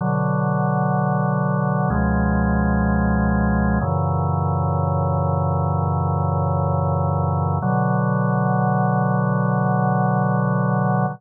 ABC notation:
X:1
M:4/4
L:1/8
Q:1/4=63
K:Bm
V:1 name="Drawbar Organ" clef=bass
[B,,D,F,]4 [C,,B,,^E,^G,]4 | [F,,^A,,C,E,]8 | [B,,D,F,]8 |]